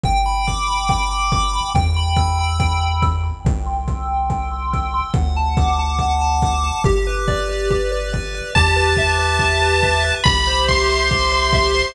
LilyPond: <<
  \new Staff \with { instrumentName = "Lead 1 (square)" } { \time 4/4 \key g \major \tempo 4 = 141 r1 | r1 | r1 | r1 |
r1 | a''1 | b''4 c'''2. | }
  \new Staff \with { instrumentName = "Lead 1 (square)" } { \time 4/4 \key g \major g''8 b''8 d'''8 b''8 g''8 b''8 d'''8 b''8 | g''8 b''8 e'''8 b''8 g''8 b''8 e'''8 b''8 | g''8 c'''8 e'''8 c'''8 g''8 c'''8 e'''8 c'''8 | fis''8 a''8 d'''8 a''8 fis''8 a''8 d'''8 a''8 |
g'8 b'8 d''8 b'8 g'8 b'8 d''8 b'8 | g'8 b'8 e''8 b'8 g'8 b'8 e''8 b'8 | g'8 c''8 e''8 c''8 g'8 c''8 e''8 c''8 | }
  \new Staff \with { instrumentName = "Synth Bass 1" } { \clef bass \time 4/4 \key g \major g,,1 | e,1 | c,1 | d,1 |
g,,1 | e,1 | c,1 | }
  \new DrumStaff \with { instrumentName = "Drums" } \drummode { \time 4/4 bd4 bd4 bd4 bd4 | bd4 bd4 bd4 bd4 | bd4 bd4 bd4 bd4 | bd4 bd4 bd4 bd4 |
bd4 bd4 bd4 bd4 | bd4 bd4 bd4 bd4 | bd4 bd4 bd4 bd4 | }
>>